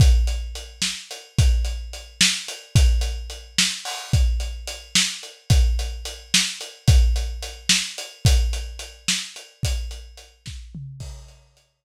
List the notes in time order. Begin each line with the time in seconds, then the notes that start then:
0.00 kick, closed hi-hat
0.27 closed hi-hat
0.55 closed hi-hat
0.82 snare
1.11 closed hi-hat
1.39 kick, closed hi-hat
1.65 closed hi-hat
1.93 closed hi-hat
2.21 snare
2.48 closed hi-hat
2.75 kick, closed hi-hat
3.01 closed hi-hat
3.30 closed hi-hat
3.58 snare
3.85 open hi-hat
4.13 kick, closed hi-hat
4.40 closed hi-hat
4.67 closed hi-hat
4.95 snare
5.23 closed hi-hat
5.50 kick, closed hi-hat
5.79 closed hi-hat
6.05 closed hi-hat
6.34 snare
6.61 closed hi-hat
6.88 kick, closed hi-hat
7.16 closed hi-hat
7.42 closed hi-hat
7.69 snare
7.98 closed hi-hat
8.25 kick, closed hi-hat
8.53 closed hi-hat
8.79 closed hi-hat
9.08 snare
9.36 closed hi-hat
9.63 kick, closed hi-hat
9.91 closed hi-hat
10.17 closed hi-hat
10.46 kick, snare
10.75 mid tom
11.00 kick, crash
11.28 closed hi-hat
11.57 closed hi-hat